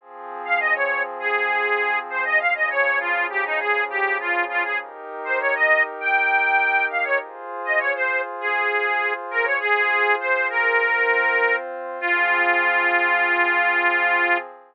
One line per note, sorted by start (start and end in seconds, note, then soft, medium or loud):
0.01 2.38 F3 loud
0.01 2.38 C4 medium
0.01 2.38 G#4 medium
0.45 0.59 F5 medium
0.60 0.74 D#5 medium
0.75 1.02 C#5 medium
1.20 1.99 G#4 medium
2.10 2.24 C5 medium
2.25 2.39 D#5 medium
2.40 4.78 C#3 loud
2.40 4.78 F3 medium
2.40 4.78 G#4 loud
2.40 2.54 F5 medium
2.55 2.69 D#5 medium
2.70 2.99 C#5 medium
3.00 3.27 F4 medium
3.30 3.44 G4 medium
3.45 3.59 D#4 medium
3.60 3.84 G#4 medium
3.90 4.17 G4 medium
4.20 4.45 F4 medium
4.49 4.63 F4 medium
4.64 4.78 G#4 medium
4.80 7.17 D#4 medium
4.80 7.17 G4 medium
4.80 7.17 A#4 medium
5.25 5.39 C5 medium
5.40 5.54 C#5 medium
5.55 5.83 D#5 medium
6.00 6.86 G5 medium
6.90 7.04 F5 medium
7.04 7.18 C#5 medium
7.20 9.57 F4 medium
7.20 9.57 G#4 medium
7.20 9.57 C5 medium
7.65 7.79 D#5 medium
7.79 7.93 C#5 medium
7.95 8.21 C5 medium
8.40 9.13 G#4 medium
9.31 9.45 A#4 medium
9.44 9.59 C#5 medium
9.60 10.78 F4 medium
9.60 10.15 G#4 loud
9.60 10.78 G#4 medium
9.60 10.78 C5 medium
10.20 10.48 C5 medium
10.50 11.56 A#4 medium
10.79 11.98 C4 medium
10.79 11.98 F4 loud
10.79 11.98 C5 loud
12.00 14.37 F3 loud
12.00 14.37 C4 loud
12.00 14.38 F4 loud
12.00 14.37 G#4 loud